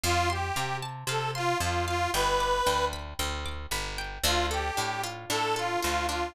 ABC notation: X:1
M:4/4
L:1/8
Q:1/4=114
K:Ddor
V:1 name="Accordion"
F G2 z A F F F | B3 z5 | F G2 z A F F F |]
V:2 name="Pizzicato Strings"
f c' f a f c' a f | g d' g b g d' b g | D A D F D A F D |]
V:3 name="Electric Bass (finger)" clef=bass
F,,2 C,2 C,2 F,,2 | G,,,2 D,,2 D,,2 G,,,2 | D,,2 A,,2 A,,2 D,,2 |]